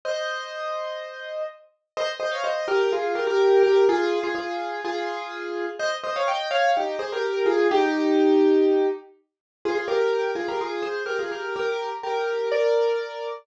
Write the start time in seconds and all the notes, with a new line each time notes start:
0.05 C5 D#5
1.97 C5 D#5
2.20 C5 D#5
2.31 C#5 F5
2.44 C5 D#5
2.68 G4 A#4
2.92 F4 G#4
3.15 G4 A#4
3.27 G4 A#4
3.63 G4 A#4
3.89 F4 G#4
4.23 F4 G#4
4.35 F4 G#4
4.84 F4 G#4
5.79 C5 D#5
6.04 C5 D#5
6.16 C#5 F5
6.28 D#5 G5
6.51 C#5 F5
6.77 D#4 G4
6.99 G#4 C5
7.12 G4 A#4
7.46 F4 G#4
7.71 D#4 G4
9.65 F4 G#4
9.75 F4 G#4
9.88 G4 A#4
10.35 F4 G#4
10.48 G4 A#4
10.61 F4 G#4
10.82 G#4 C5
11.06 G4 A#4
11.19 F4 G#4
11.31 G4 A#4
11.56 G4 A#4
12.03 G4 A#4
12.52 A#4 D5